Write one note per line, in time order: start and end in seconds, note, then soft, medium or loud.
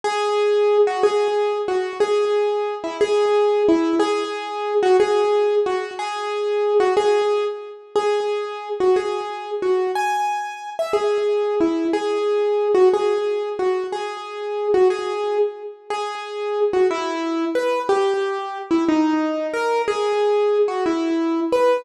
0.04 0.78 G#4 medium
0.87 1.03 F#4 medium
1.03 1.58 G#4 medium
1.68 1.98 F#4 medium
2.00 2.75 G#4 medium
2.84 2.97 E4 medium
3.01 3.63 G#4 medium
3.69 3.95 E4 medium
3.99 4.74 G#4 medium
4.83 4.97 F#4 medium
5.00 5.55 G#4 medium
5.66 5.93 F#4 medium
5.99 6.74 G#4 medium
6.80 6.94 F#4 medium
6.97 7.44 G#4 medium
7.96 8.69 G#4 medium
8.80 8.96 F#4 medium
8.96 9.51 G#4 medium
9.62 9.92 F#4 medium
9.95 10.70 G#5 medium
10.79 10.92 E5 medium
10.93 11.55 G#4 medium
11.61 11.87 E4 medium
11.93 12.68 G#4 medium
12.75 12.89 F#4 medium
12.94 13.49 G#4 medium
13.59 13.86 F#4 medium
13.92 14.68 G#4 medium
14.74 14.88 F#4 medium
14.90 15.38 G#4 medium
15.90 16.60 G#4 medium
16.73 16.87 F#4 medium
16.91 17.45 E4 medium
17.55 17.82 B4 medium
17.89 18.58 G4 medium
18.71 18.84 E4 medium
18.89 19.47 D#4 medium
19.54 19.82 A#4 medium
19.88 20.58 G#4 medium
20.68 20.84 F#4 medium
20.86 21.40 E4 medium
21.52 21.81 B4 medium